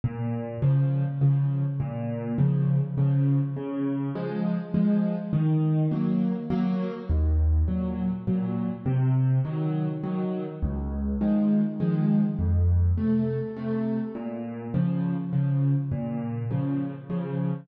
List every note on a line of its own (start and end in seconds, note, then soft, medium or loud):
0.04 0.57 A#2 loud
0.62 1.03 C#3 medium
0.62 1.03 F3 medium
1.21 1.62 C#3 medium
1.21 1.62 F3 medium
1.80 2.33 A#2 loud
2.38 2.80 C#3 medium
2.38 2.80 F3 medium
2.98 3.39 C#3 medium
2.98 3.39 F3 medium
3.56 4.09 C#3 medium
4.15 4.57 F3 medium
4.15 4.57 G#3 medium
4.74 5.15 F3 medium
4.74 5.15 G#3 medium
5.33 5.86 D#3 loud
5.91 6.33 F#3 medium
5.91 6.33 A#3 medium
6.50 6.92 F#3 medium
6.50 6.92 A#3 medium
7.09 7.62 D#2 loud
7.68 8.09 A#2 medium
7.68 8.09 F#3 medium
8.27 8.69 A#2 medium
8.27 8.69 F#3 medium
8.86 9.39 C3 loud
9.45 9.86 D#3 medium
9.45 9.86 F#3 medium
10.04 10.45 D#3 medium
10.04 10.45 F#3 medium
10.62 11.15 C#2 loud
11.21 11.62 D#3 medium
11.21 11.62 F3 medium
11.21 11.62 G#3 medium
11.80 12.21 D#3 medium
11.80 12.21 F3 medium
11.80 12.21 G#3 medium
12.39 12.92 F2 medium
12.98 13.39 C3 medium
12.98 13.39 A3 medium
13.57 13.98 C3 medium
13.57 13.98 A3 medium
14.15 14.68 A#2 medium
14.74 15.15 C#3 medium
14.74 15.15 F3 medium
15.33 15.74 C#3 medium
15.33 15.74 F3 medium
15.92 16.44 A#2 loud
16.51 16.92 C#3 medium
16.51 16.92 F3 medium
17.10 17.51 C#3 medium
17.10 17.51 F3 medium